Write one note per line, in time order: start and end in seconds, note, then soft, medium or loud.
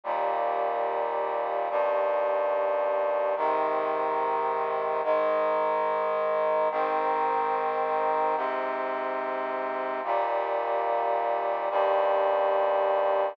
0.04 1.69 D#2 medium
0.04 1.69 A#2 medium
0.04 1.69 G3 medium
1.70 3.35 D#2 medium
1.70 3.35 G2 loud
1.70 3.35 G3 loud
3.37 5.02 G#2 medium
3.37 5.02 C3 medium
3.37 5.02 D#3 loud
5.03 6.69 G#2 loud
5.03 6.69 D#3 medium
5.03 6.69 G#3 loud
6.71 8.36 G#2 loud
6.71 8.36 D#3 loud
6.71 8.36 C4 medium
8.36 10.01 G#2 medium
8.36 10.01 C3 loud
8.36 10.01 C4 medium
10.04 11.69 D#2 medium
10.04 11.69 A#2 loud
10.04 11.69 G3 medium
11.70 13.35 D#2 loud
11.70 13.35 G2 medium
11.70 13.35 G3 loud